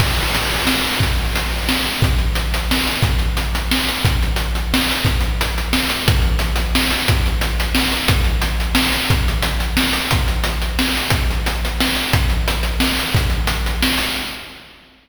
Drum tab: CC |x-----|------|------|------|
HH |--x---|x-x---|xxxx-x|xxxx-x|
SD |----o-|----o-|----o-|----o-|
BD |o-----|o-----|o-----|o-----|

CC |------|------|------|------|
HH |xxxx-x|xxxx-x|xxxx-x|xxxx-x|
SD |----o-|----o-|----o-|----o-|
BD |o-----|o-----|o-----|o-----|

CC |------|------|------|------|
HH |xxxx-x|xxxx-x|xxxx-x|xxxx-x|
SD |----o-|----o-|----o-|----o-|
BD |o-----|o-----|o-----|o-----|

CC |------|------|
HH |xxxx-x|xxxx-x|
SD |----o-|----o-|
BD |o-----|o-----|